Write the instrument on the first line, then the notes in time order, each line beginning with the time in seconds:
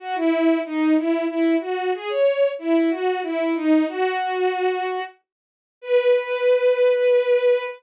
violin
0.00 F#4
0.15 E4
0.65 D#4
0.97 E4
1.28 E4
1.60 F#4
1.94 G#4
2.09 C#5
2.59 E4
2.89 F#4
3.22 E4
3.55 D#4
3.88 F#4
5.81 B4